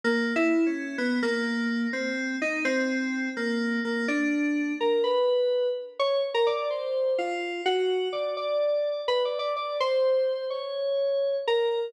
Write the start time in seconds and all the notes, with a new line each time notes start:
0.04 A#3
0.36 E4
0.66 C#4
0.98 B3
1.23 A#3
1.93 C4
2.42 D#4
2.65 C4
3.37 A#3
3.85 A#3
4.08 D4
4.80 A#4
5.04 B4
5.99 C#5
6.34 A#4
6.47 D5
6.70 C5
7.18 F4
7.66 F#4
8.13 D5
8.37 D5
9.08 B4
9.25 D5
9.39 D5
9.56 D5
9.80 C5
10.50 C#5
11.48 A#4